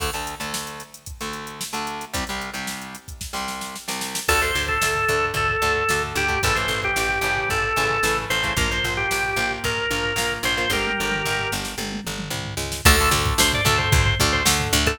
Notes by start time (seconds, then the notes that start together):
0.00 D2 D3 A3, kick, crash
0.13 D2 D3 A3, closed hi-hat
0.27 closed hi-hat
0.40 D2 D3 A3, closed hi-hat
0.54 snare
0.67 closed hi-hat
0.80 closed hi-hat
0.94 closed hi-hat
1.06 kick, closed hi-hat
1.21 D2 D3 A3, closed hi-hat
1.33 closed hi-hat
1.47 closed hi-hat
1.61 snare
1.73 D2 D3 A3, closed hi-hat
1.87 closed hi-hat
2.01 closed hi-hat
2.14 C2 C3 G3, kick, closed hi-hat
2.27 C2 C3 G3, closed hi-hat
2.42 closed hi-hat
2.54 C2 C3 G3, closed hi-hat
2.67 snare
2.81 closed hi-hat
2.95 closed hi-hat
3.08 kick, closed hi-hat
3.21 kick, snare
3.33 C2 C3 G3, snare
3.48 snare
3.61 snare
3.76 snare
3.88 C2 C3 G3, snare
4.01 snare
4.15 snare
4.28 D2 D3 A3 A4, kick, crash
4.42 D3 A3 C5, floor tom
4.55 D2, floor tom
4.68 A4, kick, floor tom
4.82 D2, snare
4.95 floor tom
5.08 D2 D3 A3, floor tom
5.23 floor tom
5.34 D2 A4, kick, floor tom
5.49 floor tom
5.62 D2 D3 A3, floor tom
5.75 floor tom
5.89 D2 D3 A3, snare
6.02 floor tom
6.15 D2 G4, floor tom
6.28 D3 A3, kick, floor tom
6.43 A1 C#3 E3 A3 A4, kick, floor tom
6.55 C#3 E3 A3 C5, floor tom
6.68 A1, floor tom
6.83 G4, kick, floor tom
6.96 A1, snare
7.09 floor tom
7.21 A1 C#3 E3 A3, floor tom
7.37 floor tom
7.49 A1 A4, kick, floor tom
7.63 floor tom
7.76 A1 C#3 E3 A3, floor tom
7.91 floor tom
8.03 A1 C#3 E3 A3, snare
8.18 floor tom
8.30 A1 C5, floor tom
8.43 C#3 E3 A3, kick, floor tom
8.57 A#1 F3 A#3 A#4, kick, floor tom
8.70 F3 A#3 C5, floor tom
8.84 A#1, floor tom
8.97 G4, floor tom
9.11 A#1, snare
9.24 floor tom
9.36 A#1 F3 A#3, floor tom
9.51 floor tom
9.64 A#1 A#4, kick, floor tom
9.78 floor tom
9.91 A#1 F3 A#3, floor tom
10.04 floor tom
10.16 A#1 F3 A#3, snare
10.31 floor tom
10.43 A#1 C5, floor tom
10.57 F3 A#3, floor tom
10.70 G1 G4 A#4, kick, high tom
10.85 high tom
10.98 G1, mid tom
11.11 mid tom
11.25 G1, floor tom
11.39 floor tom
11.52 G1, snare
11.65 snare
11.78 G1, high tom
11.92 high tom
12.05 G1, mid tom
12.19 mid tom
12.30 C2, floor tom
12.46 floor tom
12.57 C#2, snare
12.72 snare
12.85 D2 D3 A3 A4, kick, crash
13.00 D3 A3, floor tom
13.11 D2, floor tom
13.26 kick, floor tom
13.38 D2 C5, snare
13.53 D5, floor tom
13.65 D2 D3 A3 A4, floor tom
13.78 C5, floor tom
13.92 D2, kick, floor tom
14.06 floor tom
14.19 D2 D3 A3, floor tom
14.33 C5, floor tom
14.45 D2 D3 A3, snare
14.60 floor tom
14.73 D2, floor tom
14.86 D3 A3 A4, kick, floor tom